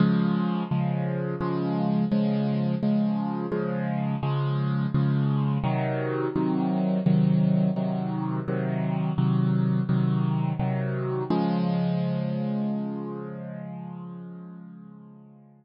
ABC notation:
X:1
M:4/4
L:1/8
Q:1/4=85
K:Db
V:1 name="Acoustic Grand Piano" clef=bass
[D,F,A,]2 [D,F,A,]2 [D,F,A,]2 [D,F,A,]2 | [D,F,A,]2 [D,F,A,]2 [D,F,A,]2 [D,F,A,]2 | [C,E,G,]2 [C,E,G,]2 [C,E,G,]2 [C,E,G,]2 | [C,E,G,]2 [C,E,G,]2 [C,E,G,]2 [C,E,G,]2 |
[D,F,A,]8- | [D,F,A,]8 |]